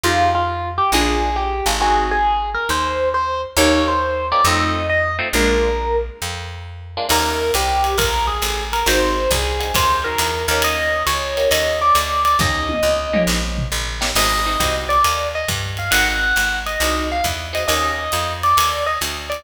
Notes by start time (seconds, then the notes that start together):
0.03 F2 D#4 F4 G4 G#4
0.35 F4
0.78 G4
0.92 A#1 D4 F4 G#4 A#4
1.36 G4
1.66 G#1 D4 F4 G#4 A#4
1.80 C4 D#4 F#4 G#4
2.11 G#4
2.54 A#4
2.69 D#2 C5
3.14 C5
3.57 D#2 A#3 C#4 D#4 G4 C#5
3.88 C5
4.32 A#3 C#4 D#4 G4 D5
4.44 F2 A3 C4 D#4 F4 D#5
4.89 D#5
5.19 A3 C4 D#4 F4
5.33 A#1 G#3 A#3 D4 F4 A#4
6.22 F2
6.97 G#3 A#3 D4 F4
7.09 D#2 A#3 C#4 D#4 G4 A#4, crash, ride
7.54 C2 G4, hi-hat pedal, ride
7.84 ride
7.98 A#1 A#4, kick, ride
8.27 G#4
8.42 A1, hi-hat pedal, ride
8.73 A#4, ride
8.86 G#1 C4 D#4 F#4 G#4 C5, ride
9.31 C2 G#4, kick, hi-hat pedal, ride
9.60 C4 D#4 F#4 G#4, ride
9.74 D#2 C5, kick, ride
10.04 C4 D#4 F#4 G#4 A#4
10.18 E2, hi-hat pedal, ride
10.48 D#2 A#3 C#4 D#4 G4 A#4, ride
10.62 D#5, ride
11.06 C#2 C#5, hi-hat pedal, ride
11.37 A#3 C#4 D#4 G4, ride
11.51 D#2 D#5, ride
11.81 D5
11.95 D2, hi-hat pedal, ride
12.25 D5, ride
12.39 D#2 A#3 C#4 D#4 G4 D#5, kick, snare
12.69 high tom
12.83 C#2
13.13 A#3 C#4 D#4 G4, mid tom
13.27 A#1, snare
13.58 floor tom
13.72 A1
14.01 A#3 C#4 D#4 G4, snare
14.15 G#1 C4 D#4 F#4 G#4 D#5, crash, ride
14.46 C4 D#4 F#4 G#4
14.60 C2 C4 D#4 F#4 G#4, kick, hi-hat pedal, ride
14.89 D5, ride
15.04 D#2, ride
15.35 D#5
15.48 G2, kick, hi-hat pedal, ride
15.77 F5, ride
15.91 G#1 C4 D#4 F#4 G#4 F#5, ride
16.36 G#1, hi-hat pedal, ride
16.66 D#5, ride
16.80 C2 C4 D#4 F#4 G#4, ride
17.12 F5
17.24 E2, kick, hi-hat pedal, ride
17.53 C4 D#4 F#4 G#4 D#5, ride
17.68 D#2 A#3 C#4 D#4 G4 D#5, ride
18.12 F2, hi-hat pedal, ride
18.43 D5, ride
18.57 D#2, ride
18.86 D#5
19.01 D2, hi-hat pedal, ride
19.30 D5, ride